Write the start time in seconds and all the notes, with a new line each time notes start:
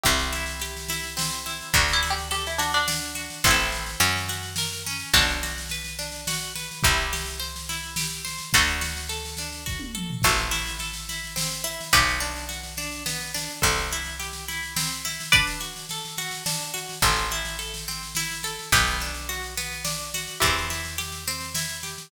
0.03 C2 C4 E4 G4, kick, snare
0.19 snare
0.33 E4, snare
0.46 snare
0.60 G4, snare
0.77 snare
0.88 E4, snare
1.03 snare
1.17 C4, snare
1.31 snare
1.46 E4, snare
1.61 snare
1.73 D2 D4 F#4, kick, snare
1.88 snare
1.93 E4
2.03 F#4, snare
2.10 G4
2.18 snare
2.31 G4 A4, snare
2.46 E4, snare
2.58 D4 F#4, snare
2.72 D4, snare
2.88 D4, snare
3.02 snare
3.15 F#4, snare
3.30 snare
3.44 A1 C4 E4, kick, snare
3.51 A4
3.58 snare
3.72 snare
3.86 snare
4.00 F#2 C#4, snare
4.16 snare
4.28 F#4, snare
4.43 snare
4.56 A#4, snare
4.72 snare
4.86 C#4, snare
5.00 snare
5.13 B1 D4 F#4, kick, snare
5.27 snare
5.43 F#4, snare
5.58 snare
5.69 B4, snare
5.84 snare
5.99 D4, snare
6.12 snare
6.27 F#4, snare
6.40 snare
6.55 B4, snare
6.71 snare
6.83 C2 E4 G4, kick, snare
6.97 snare
7.13 G4, snare
7.26 snare
7.40 C5, snare
7.56 snare
7.69 E4, snare
7.83 snare
7.96 G4, snare
8.11 snare
8.25 C5, snare
8.38 snare
8.53 D2 D4 F#4 A4, kick, snare
8.67 snare
8.81 F#4, snare
8.97 snare
9.09 A4, snare
9.25 snare
9.37 D4, snare
9.52 snare
9.66 F#4, kick, snare
9.79 high tom
9.95 A4, mid tom
10.10 floor tom
10.22 A1 C4 F#4 A4, kick, snare, crash
10.38 snare
10.51 E4, snare
10.66 snare
10.79 A4, snare
10.93 snare
11.09 E4, snare
11.24 snare
11.36 C4, snare
11.51 snare
11.64 E4, snare
11.81 snare
11.93 B1 B3 G4 B4, kick, snare
12.07 snare
12.20 D4, snare
12.36 snare
12.49 F#4, snare
12.63 snare
12.77 D4, snare
12.91 snare
13.06 B3, snare
13.21 snare
13.34 D4, snare
13.49 snare
13.62 C2 C4 A4 C5, kick, snare
13.78 snare
13.91 E4, snare
14.04 snare
14.20 G4, snare
14.33 snare
14.48 E4, snare
14.63 snare
14.76 C4, snare
14.91 snare
15.05 E4, snare
15.20 snare
15.32 D4 B4 D5, kick, snare
15.47 snare
15.60 F#4, snare
15.76 snare
15.89 A4, snare
16.05 snare
16.17 F#4, snare
16.31 snare
16.46 D4, snare
16.60 snare
16.74 F#4, snare
16.89 snare
17.02 A1 C4 A4 C5, kick, snare
17.16 snare
17.31 E4, snare
17.45 snare
17.59 A4, snare
17.74 snare
17.88 C4, snare
18.03 snare
18.15 E4, snare
18.31 snare
18.43 A4, snare
18.59 snare
18.72 B1 B3 G4 B4, kick, snare
18.87 snare
19.00 D4, snare
19.14 snare
19.29 F#4, snare
19.43 snare
19.57 B3, snare
19.72 snare
19.85 D4, snare
20.00 snare
20.14 F#4, snare
20.27 snare
20.40 E2 C4 E4 G4, kick, snare
20.57 snare
20.70 E4, snare
20.85 snare
20.98 G4, snare
21.12 snare
21.27 C4, snare
21.40 snare
21.54 E4, snare
21.69 snare
21.83 G4, snare
21.98 snare